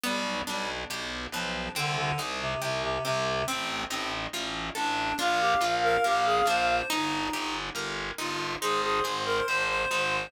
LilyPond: <<
  \new Staff \with { instrumentName = "Clarinet" } { \time 4/4 \key c \minor \tempo 4 = 70 r1 | r2 f''2 | r2 c''2 | }
  \new Staff \with { instrumentName = "Clarinet" } { \time 4/4 \key c \minor g8 g16 r8. f8 d16 d16 r16 c16 c16 c16 c8 | c'8 c'16 r8. d'8 f'16 g'16 r16 bes'16 g'16 aes'16 c''8 | ees'8 ees'16 r8. f'8 aes'16 aes'16 r16 bes'16 c''16 c''16 c''8 | }
  \new Staff \with { instrumentName = "Orchestral Harp" } { \time 4/4 \key c \minor b8 d'8 g'8 b8 c'8 ees'8 g'8 c'8 | c'8 ees'8 f'8 a'8 d'8 f'8 bes'8 d'8 | ees'8 g'8 bes'8 ees'8 ees'8 aes'8 c''8 ees'8 | }
  \new Staff \with { instrumentName = "Electric Bass (finger)" } { \clef bass \time 4/4 \key c \minor b,,8 b,,8 b,,8 b,,8 c,8 c,8 c,8 c,8 | a,,8 a,,8 a,,8 a,,8 bes,,8 bes,,8 bes,,8 bes,,8 | g,,8 g,,8 g,,8 g,,8 aes,,8 aes,,8 aes,,8 aes,,8 | }
>>